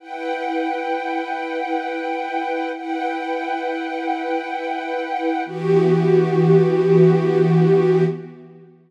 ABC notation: X:1
M:4/4
L:1/8
Q:1/4=88
K:Edor
V:1 name="String Ensemble 1"
[EBfg]8 | [EBfg]8 | [E,B,FG]8 |]